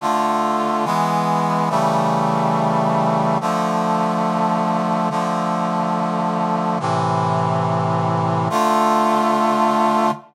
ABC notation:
X:1
M:4/4
L:1/8
Q:1/4=141
K:Dm
V:1 name="Brass Section"
[D,A,F]4 [E,^G,=B,]4 | [^C,E,G,A,]8 | [D,F,A,]8 | [D,F,A,]8 |
[A,,C,E,]8 | [D,A,F]8 |]